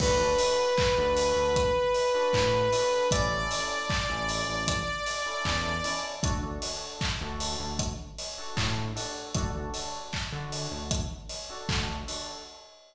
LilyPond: <<
  \new Staff \with { instrumentName = "Lead 2 (sawtooth)" } { \time 4/4 \key d \major \tempo 4 = 77 b'1 | d''1 | r1 | r1 | }
  \new Staff \with { instrumentName = "Electric Piano 2" } { \time 4/4 \key d \major <d' fis' a'>16 <d' fis' a'>4 <d' fis' a'>4. <d' fis' a'>8. <d' fis' a'>8 | <cis' e' a'>16 <cis' e' a'>4 <cis' e' a'>4. <cis' e' a'>8. <cis' e' a'>8 | <d' fis' a'>16 <d' fis' a'>4 <d' fis' a'>4. <d' fis' a'>8. <d' fis' a'>8 | <d' fis' a'>16 <d' fis' a'>4 <d' fis' a'>4. <d' fis' a'>8. <d' fis' a'>8 | }
  \new Staff \with { instrumentName = "Synth Bass 1" } { \clef bass \time 4/4 \key d \major d,4~ d,16 d,8 d,4~ d,16 a,4 | a,,4~ a,,16 a,,8 a,,4~ a,,16 e,4 | d,4~ d,16 d,8 d,4~ d,16 a,4 | d,4~ d,16 d8 d,4~ d,16 d,4 | }
  \new DrumStaff \with { instrumentName = "Drums" } \drummode { \time 4/4 <cymc bd>8 hho8 <hc bd>8 hho8 <hh bd>8 hho8 <hc bd>8 hho8 | <hh bd>8 hho8 <hc bd>8 hho8 <hh bd>8 hho8 <hc bd>8 hho8 | <hh bd>8 hho8 <hc bd>8 hho8 <hh bd>8 hho8 <hc bd>8 hho8 | <hh bd>8 hho8 <hc bd>8 hho8 <hh bd>8 hho8 <hc bd>8 hho8 | }
>>